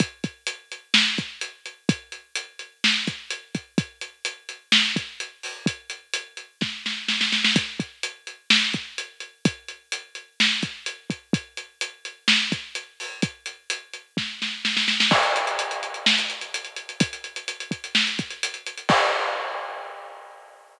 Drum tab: CC |----------------|----------------|----------------|----------------|
HH |x-x-x-x---x-x-x-|x-x-x-x---x-x-x-|x-x-x-x---x-x-o-|x-x-x-x---------|
SD |--------o-------|--------o-------|--------o-------|--------o-o-oooo|
BD |o-o-------o-----|o---------o---o-|o---------o-----|o-------o-------|

CC |----------------|----------------|----------------|----------------|
HH |x-x-x-x---x-x-x-|x-x-x-x---x-x-x-|x-x-x-x---x-x-o-|x-x-x-x---------|
SD |--------o-------|--------o-------|--------o-------|--------o-o-oooo|
BD |o-o-------o-----|o---------o---o-|o---------o-----|o-------o-------|

CC |x---------------|----------------|x---------------|
HH |-xxxxxxx-xxxxxxx|xxxxxxxx-xxxxxxx|----------------|
SD |--------o-------|--------o-------|----------------|
BD |o---------------|o-----o---o-----|o---------------|